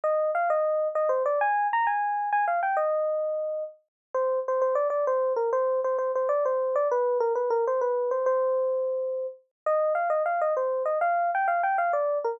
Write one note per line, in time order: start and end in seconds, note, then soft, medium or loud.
0.04 0.31 D#5 medium
0.35 0.49 F5 medium
0.50 0.88 D#5 medium
0.95 1.10 D#5 medium
1.09 1.23 C5 medium
1.26 1.39 D5 medium
1.41 1.67 G#5 medium
1.73 1.87 A#5 medium
1.87 2.30 G#5 medium
2.33 2.45 G#5 medium
2.48 2.60 F5 medium
2.63 2.76 G5 medium
2.77 3.64 D#5 medium
4.14 4.39 C5 medium
4.48 4.61 C5 medium
4.62 4.74 C5 medium
4.75 4.88 D5 medium
4.90 5.05 D5 medium
5.07 5.33 C5 medium
5.36 5.50 A#4 medium
5.53 5.80 C5 medium
5.84 5.97 C5 medium
5.98 6.12 C5 medium
6.15 6.28 C5 medium
6.29 6.44 D5 medium
6.45 6.75 C5 medium
6.76 6.88 D5 medium
6.91 7.18 B4 medium
7.20 7.33 A#4 medium
7.35 7.49 B4 medium
7.50 7.65 A#4 medium
7.67 7.80 C5 medium
7.81 8.10 B4 medium
8.11 8.26 C5 medium
8.26 9.27 C5 medium
9.66 9.93 D#5 medium
9.95 10.09 F5 medium
10.10 10.23 D#5 medium
10.26 10.41 F5 medium
10.41 10.54 D#5 medium
10.57 10.83 C5 medium
10.85 10.98 D#5 medium
11.01 11.31 F5 medium
11.35 11.47 G5 medium
11.48 11.62 F5 medium
11.63 11.77 G5 medium
11.78 11.92 F5 medium
11.93 12.18 D5 medium
12.24 12.38 A#4 medium